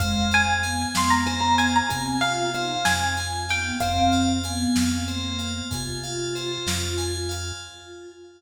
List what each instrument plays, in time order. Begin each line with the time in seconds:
0.00 synth bass 1 F2, choir aahs G#3, tubular bells C5, pizzicato strings F5, kick, closed hi-hat
0.31 tubular bells F5, pizzicato strings G#5, closed hi-hat
0.48 choir aahs G#3
0.63 choir aahs B3, tubular bells G#5, closed hi-hat
0.95 synth bass 1 F2, tubular bells F5, pizzicato strings C6, snare
1.10 pizzicato strings A#5
1.26 tubular bells C5, pizzicato strings G#5, closed hi-hat
1.41 pizzicato strings A#5
1.58 tubular bells F5, pizzicato strings G#5, closed hi-hat
1.76 pizzicato strings A#5
1.90 synth bass 1 C3, choir aahs C4, pizzicato strings G#5, tubular bells G#5, kick, closed hi-hat
2.21 choir aahs F4, pizzicato strings F5, tubular bells F5, closed hi-hat
2.54 choir aahs D#4, tubular bells C5, pizzicato strings F5, closed hi-hat
2.85 synth bass 1 F2, tubular bells F5, pizzicato strings G#5, snare
3.17 tubular bells G#5, pizzicato strings G#5, closed hi-hat
3.49 choir aahs B3, tubular bells F5, pizzicato strings G5, closed hi-hat
3.80 synth bass 1 F2, choir aahs C4, tubular bells C5, pizzicato strings F5, kick, closed hi-hat
4.12 tubular bells F5, closed hi-hat
4.44 choir aahs B3, tubular bells G#5, closed hi-hat
4.76 synth bass 1 F2, tubular bells F5, snare
5.08 choir aahs A#3, tubular bells C5, closed hi-hat
5.39 tubular bells F5, closed hi-hat
5.71 synth bass 1 C3, choir aahs F4, tubular bells G#5, kick, closed hi-hat
6.03 tubular bells F5, closed hi-hat
6.35 tubular bells C5, closed hi-hat
6.67 synth bass 1 F2, tubular bells F5, snare
6.97 tubular bells G#5, closed hi-hat
7.29 tubular bells F5, closed hi-hat